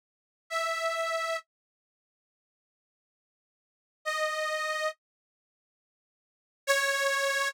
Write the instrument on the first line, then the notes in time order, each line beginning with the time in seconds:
accordion
0.50 E5
4.05 D#5
6.67 C#5